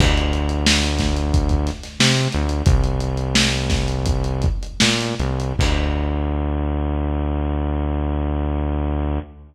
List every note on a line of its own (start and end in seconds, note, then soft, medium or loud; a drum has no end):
0.00 1.70 D2 loud
0.00 kick loud
0.00 crash loud
0.18 closed hi-hat medium
0.33 closed hi-hat medium
0.49 closed hi-hat medium
0.66 snare loud
0.83 closed hi-hat medium
0.99 kick medium
0.99 snare medium
0.99 closed hi-hat loud
1.17 closed hi-hat medium
1.34 kick loud
1.34 closed hi-hat loud
1.49 kick medium
1.49 closed hi-hat medium
1.67 snare soft
1.67 closed hi-hat medium
1.83 snare soft
1.83 closed hi-hat medium
2.00 2.28 C3 medium
2.00 snare loud
2.17 closed hi-hat medium
2.33 2.63 D2 loud
2.33 closed hi-hat medium
2.49 closed hi-hat medium
2.66 4.47 C2 loud
2.66 kick loud
2.66 closed hi-hat loud
2.84 closed hi-hat medium
3.00 closed hi-hat medium
3.17 closed hi-hat medium
3.35 snare loud
3.52 closed hi-hat medium
3.70 kick loud
3.70 snare medium
3.70 closed hi-hat medium
3.88 closed hi-hat medium
4.06 kick loud
4.06 closed hi-hat loud
4.24 closed hi-hat medium
4.42 kick loud
4.42 closed hi-hat medium
4.63 closed hi-hat medium
4.80 5.15 A#2 loud
4.80 snare loud
5.01 closed hi-hat medium
5.20 5.53 C2 loud
5.20 closed hi-hat medium
5.40 closed hi-hat medium
5.59 9.19 D2 loud
5.59 kick loud
5.59 crash loud